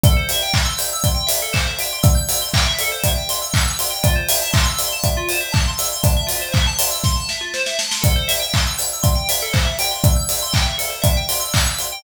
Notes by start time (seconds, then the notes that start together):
0.04 A4, kick, closed hi-hat
0.17 C5
0.29 E5, open hi-hat
0.42 G5
0.54 C6, kick, clap
0.65 E6
0.78 G6, open hi-hat
0.93 E6
1.04 C6, kick, closed hi-hat
1.15 G5
1.27 E5, open hi-hat
1.42 A4
1.53 C5, kick, clap
1.66 E5
1.79 G5, open hi-hat
1.93 C6
2.03 E6, kick, closed hi-hat
2.15 G6
2.29 E6, open hi-hat
2.42 C6
2.54 G5, kick, clap
2.66 E5
2.79 A4, open hi-hat
2.92 C5
3.04 E5, kick, closed hi-hat
3.16 G5
3.29 C6, open hi-hat
3.42 E6
3.54 G6, kick, clap
3.66 E6
3.79 C6, open hi-hat
3.90 G5
4.03 F4, kick, closed hi-hat
4.16 C5
4.29 E5, open hi-hat
4.41 A5
4.53 C6, kick, clap
4.65 E6
4.79 C6, open hi-hat
4.92 A5
5.04 E5, kick, closed hi-hat
5.17 F4
5.29 C5, open hi-hat
5.40 E5
5.52 A5, kick, clap
5.67 C6
5.78 E6, open hi-hat
5.92 C6
6.03 A5, kick, closed hi-hat
6.17 E5
6.27 F4, open hi-hat
6.42 C5
6.52 E5, kick, clap
6.67 A5
6.78 C6, open hi-hat
6.91 E6
7.04 C6, kick, snare
7.16 A5
7.29 E5, snare
7.41 F4
7.54 C5, snare
7.66 E5, snare
7.79 A5, snare
7.91 C6, snare
8.02 A4, kick, closed hi-hat
8.16 C5
8.28 E5, open hi-hat
8.40 G5
8.53 C6, kick, clap
8.67 E6
8.78 G6, open hi-hat
8.93 E6
9.03 C6, kick, closed hi-hat
9.15 G5
9.29 E5, open hi-hat
9.42 A4
9.53 C5, kick, clap
9.65 E5
9.79 G5, open hi-hat
9.91 C6
10.04 E6, kick, closed hi-hat
10.16 G6
10.29 E6, open hi-hat
10.43 C6
10.53 G5, kick, clap
10.65 E5
10.78 A4, open hi-hat
10.90 C5
11.02 E5, kick, closed hi-hat
11.17 G5
11.29 C6, open hi-hat
11.40 E6
11.54 G6, kick, clap
11.66 E6
11.79 C6, open hi-hat
11.92 G5